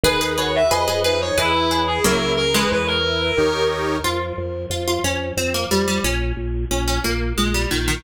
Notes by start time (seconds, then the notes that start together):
0.03 D#2 D#4 G#4 B4
0.21 G#4 B4
0.37 F#4 G#4 B4 C#5
0.56 E5
0.71 F2 G#4 B4 D#5
0.88 G#4 B4
1.04 D#4 G#4 B4
1.21 C#5
1.38 E2 E4 G#4 B4
1.71 G#4 B4
1.87 G#4
2.04 C#2 F#3 A#3 E4 A#4
2.37 A#4
2.54 E3 G#3 B4
2.71 E2 B4 C#5
2.87 A#4
3.04 E4
3.37 D#2 D#4 G4 A#4 C#5
4.04 F2 F4
4.38 F2
4.70 F2 F4
4.88 F4
5.04 F2 C#4
5.37 F2 C4
5.54 A#3
5.71 F2 G3
5.88 G3
6.04 A#1 C#4
6.37 A#1
6.71 A#1 C#4
6.88 C#4
7.04 A#1 A#3
7.38 A#1 G#3
7.54 G3
7.71 A#1 D#3
7.88 D#3